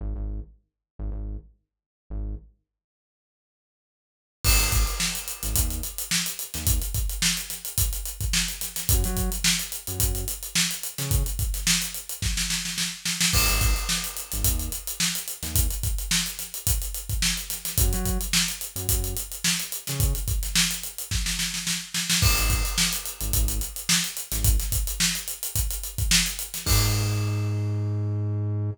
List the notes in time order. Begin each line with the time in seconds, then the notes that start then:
0.01 G#1
0.16 G#1
0.99 G#1
1.12 G#1
2.10 G#1
4.44 G#1, kick, crash
4.59 G#1, closed hi-hat
4.72 kick, snare, closed hi-hat
4.87 closed hi-hat
5.00 snare
5.15 closed hi-hat
5.28 closed hi-hat
5.43 G#1, snare, closed hi-hat
5.56 D#2, kick, closed hi-hat
5.70 closed hi-hat
5.83 closed hi-hat
5.98 closed hi-hat
6.11 snare
6.26 closed hi-hat
6.39 closed hi-hat
6.54 D#2, snare, closed hi-hat
6.67 kick, closed hi-hat
6.82 closed hi-hat
6.94 kick, closed hi-hat
7.09 closed hi-hat
7.22 snare
7.37 closed hi-hat
7.50 snare, closed hi-hat
7.65 closed hi-hat
7.78 kick, closed hi-hat
7.93 closed hi-hat
8.05 closed hi-hat
8.21 kick, closed hi-hat
8.33 snare
8.48 closed hi-hat
8.61 snare, closed hi-hat
8.76 snare, closed hi-hat
8.89 F#2, kick, closed hi-hat
9.04 F#3, closed hi-hat
9.17 kick, closed hi-hat
9.32 closed hi-hat
9.44 snare
9.59 closed hi-hat
9.72 closed hi-hat
9.87 F#2, closed hi-hat
10.00 F#2, kick, closed hi-hat
10.15 closed hi-hat
10.28 closed hi-hat
10.43 closed hi-hat
10.55 snare
10.71 closed hi-hat
10.83 closed hi-hat
10.98 C#3, snare, closed hi-hat
11.11 kick, closed hi-hat
11.26 closed hi-hat
11.39 kick, closed hi-hat
11.54 snare, closed hi-hat
11.67 snare
11.82 snare, closed hi-hat
11.94 closed hi-hat
12.09 closed hi-hat
12.22 kick, snare
12.37 snare
12.50 snare
12.65 snare
12.78 snare
13.05 snare
13.21 snare
13.33 G#1, kick, crash
13.48 G#1, closed hi-hat
13.61 kick, snare, closed hi-hat
13.76 closed hi-hat
13.89 snare
14.04 closed hi-hat
14.17 closed hi-hat
14.32 G#1, snare, closed hi-hat
14.44 D#2, kick, closed hi-hat
14.59 closed hi-hat
14.72 closed hi-hat
14.87 closed hi-hat
15.00 snare
15.15 closed hi-hat
15.28 closed hi-hat
15.43 D#2, snare, closed hi-hat
15.55 kick, closed hi-hat
15.70 closed hi-hat
15.83 kick, closed hi-hat
15.98 closed hi-hat
16.11 snare
16.26 closed hi-hat
16.39 snare, closed hi-hat
16.54 closed hi-hat
16.67 kick, closed hi-hat
16.82 closed hi-hat
16.94 closed hi-hat
17.09 kick, closed hi-hat
17.22 snare
17.37 closed hi-hat
17.50 snare, closed hi-hat
17.65 snare, closed hi-hat
17.78 F#2, kick, closed hi-hat
17.93 F#3, closed hi-hat
18.05 kick, closed hi-hat
18.21 closed hi-hat
18.33 snare
18.48 closed hi-hat
18.61 closed hi-hat
18.76 F#2, closed hi-hat
18.89 F#2, kick, closed hi-hat
19.04 closed hi-hat
19.17 closed hi-hat
19.32 closed hi-hat
19.44 snare
19.59 closed hi-hat
19.72 closed hi-hat
19.87 C#3, snare, closed hi-hat
20.00 kick, closed hi-hat
20.15 closed hi-hat
20.28 kick, closed hi-hat
20.43 snare, closed hi-hat
20.55 snare
20.71 snare, closed hi-hat
20.83 closed hi-hat
20.98 closed hi-hat
21.11 kick, snare
21.26 snare
21.39 snare
21.54 snare
21.67 snare
21.94 snare
22.10 snare
22.22 G#1, kick, crash
22.37 G#1, closed hi-hat
22.50 kick, closed hi-hat
22.65 closed hi-hat
22.78 snare
22.93 closed hi-hat
23.06 closed hi-hat
23.21 G#1, closed hi-hat
23.33 G#1, kick, closed hi-hat
23.48 closed hi-hat
23.61 closed hi-hat
23.76 closed hi-hat
23.89 snare
24.04 snare, closed hi-hat
24.17 closed hi-hat
24.32 G#1, snare, closed hi-hat
24.44 kick, closed hi-hat
24.59 snare, closed hi-hat
24.72 kick, closed hi-hat
24.87 closed hi-hat
25.00 snare
25.15 closed hi-hat
25.28 closed hi-hat
25.43 closed hi-hat
25.56 kick, closed hi-hat
25.70 closed hi-hat
25.83 closed hi-hat
25.98 kick, closed hi-hat
26.11 snare
26.26 closed hi-hat
26.39 closed hi-hat
26.54 snare, closed hi-hat
26.66 G#2, kick, crash